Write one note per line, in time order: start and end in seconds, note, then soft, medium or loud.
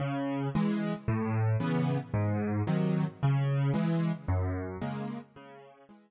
0.00 0.48 C#3 loud
0.55 0.93 E3 medium
0.55 0.93 G#3 loud
1.08 1.56 A2 loud
1.60 1.98 C#3 medium
1.60 1.98 E3 medium
1.60 1.98 B3 medium
2.14 2.62 G#2 loud
2.67 3.05 C3 medium
2.67 3.05 D#3 medium
2.67 3.05 F#3 medium
3.23 3.71 C#3 loud
3.74 4.11 E3 medium
3.74 4.11 G#3 medium
4.28 4.77 F#2 loud
4.81 5.19 C#3 medium
4.81 5.19 G#3 medium
4.81 5.19 A#3 medium
5.36 5.84 C#3 loud
5.89 6.11 E3 medium
5.89 6.11 G#3 medium